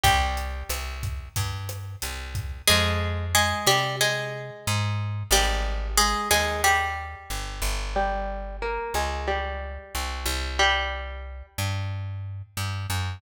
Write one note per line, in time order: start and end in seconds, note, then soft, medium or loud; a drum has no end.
0.04 0.63 C2 loud
0.04 0.98 G3 medium
0.04 0.98 G4 loud
0.04 kick medium
0.04 closed hi-hat medium
0.37 closed hi-hat medium
0.70 1.29 C2 medium
0.70 cross-stick medium
0.70 closed hi-hat medium
1.03 kick medium
1.03 closed hi-hat medium
1.36 1.96 G2 medium
1.36 kick medium
1.36 closed hi-hat medium
1.69 cross-stick medium
1.69 closed hi-hat medium
2.02 2.62 C2 medium
2.02 closed hi-hat medium
2.35 kick medium
2.35 closed hi-hat medium
2.67 3.54 F2 loud
2.67 3.25 G#3 loud
2.67 3.25 G#4 loud
3.35 3.67 G#3 medium
3.35 3.67 G#4 loud
3.66 4.51 C3 medium
3.66 3.96 G3 medium
3.66 3.96 G4 loud
4.01 5.10 G#3 medium
4.01 5.10 G#4 medium
4.67 5.23 G#2 loud
5.31 6.15 G#1 loud
5.31 5.88 G3 loud
5.31 5.88 G4 loud
5.98 6.29 G#3 loud
5.98 6.29 G#4 loud
6.31 7.15 D#2 medium
6.31 6.62 G#3 medium
6.31 6.62 G#4 loud
6.64 7.84 G3 medium
6.64 7.84 G4 loud
7.30 7.61 G1 medium
7.62 8.79 G1 medium
7.96 8.56 G3 loud
7.96 8.56 G4 loud
8.62 8.94 A#3 loud
8.62 8.94 A#4 loud
8.94 9.78 C#2 medium
8.94 9.27 G#3 medium
8.94 9.27 G#4 loud
9.28 10.44 G3 medium
9.28 10.44 G4 medium
9.95 10.25 C2 medium
10.26 11.43 C2 loud
10.59 11.46 G3 loud
10.59 11.46 G4 loud
11.58 12.42 G2 medium
12.57 12.87 G2 medium
12.90 13.20 F#2 medium